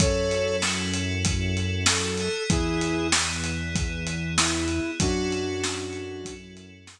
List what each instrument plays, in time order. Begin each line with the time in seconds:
0.00 synth bass 1 F#2, electric piano 2 C#4 E4 F#4 A4, flute A4 C#5, kick, closed hi-hat
0.31 closed hi-hat
0.62 snare
0.93 closed hi-hat
1.25 kick, closed hi-hat
1.57 closed hi-hat
1.86 flute A4, snare
2.17 electric piano 2 B3 E4 G#4, closed hi-hat
2.50 synth bass 1 E2, flute E4 G#4, kick, closed hi-hat
2.81 closed hi-hat
3.12 snare
3.44 closed hi-hat
3.75 kick, closed hi-hat
4.07 closed hi-hat
4.38 flute E4, snare
4.68 closed hi-hat
5.00 synth bass 1 F#2, electric piano 2 C#4 E4 F#4 A4, flute D4 F#4, kick, closed hi-hat
5.32 closed hi-hat
5.64 snare
5.93 closed hi-hat
6.25 kick, closed hi-hat
6.57 closed hi-hat
6.87 snare